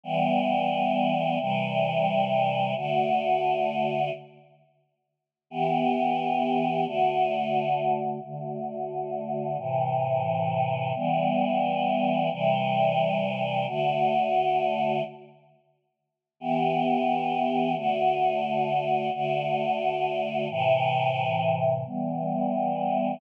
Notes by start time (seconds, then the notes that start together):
0.04 E3 G3 B3
1.39 C3 E3 G3
2.76 D3 A3 F#4
5.50 E3 B3 G4
6.85 D3 A3 F#4
8.22 D3 A3 F#4
9.58 A2 C3 E3
10.95 E3 G3 B3
12.31 C3 E3 G3
13.67 D3 A3 F#4
16.40 E3 B3 G4
17.75 D3 A3 F#4
19.13 D3 A3 F#4
20.49 A2 C3 E3
21.85 E3 G3 B3